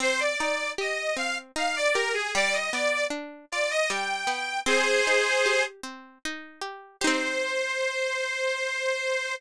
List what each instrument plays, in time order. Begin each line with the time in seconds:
0.00 pizzicato strings C4, accordion C5
0.20 accordion D5
0.39 pizzicato strings D#4, accordion D5
0.78 pizzicato strings G4, accordion D#5
1.17 pizzicato strings C4, accordion F5
1.56 pizzicato strings D#4, accordion F5
1.76 accordion D5
1.94 pizzicato strings G4, accordion A#4
2.13 accordion G#4
2.35 pizzicato strings G3, accordion D5
2.53 accordion D#5
2.73 pizzicato strings B3, accordion D5
3.10 pizzicato strings D4
3.52 pizzicato strings F4, accordion D5
3.71 accordion D#5
3.90 pizzicato strings G3, accordion G5
4.27 pizzicato strings B3
4.66 pizzicato strings C4, accordion G#4 C5
5.07 pizzicato strings D#4
5.46 pizzicato strings G4
5.83 pizzicato strings C4
6.25 pizzicato strings D#4
6.62 pizzicato strings G4
7.01 pizzicato strings D#4 G4, accordion C5
7.07 pizzicato strings C4